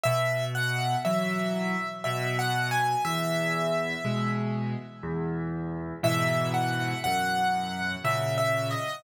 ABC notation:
X:1
M:3/4
L:1/8
Q:1/4=60
K:E
V:1 name="Acoustic Grand Piano"
e f e2 (3e f g | e3 z3 | e f f2 (3e e d |]
V:2 name="Acoustic Grand Piano" clef=bass
B,,2 [E,F,]2 B,,2 | E,,2 [B,,G,]2 E,,2 | [G,,B,,E,]2 F,,2 [^A,,C,]2 |]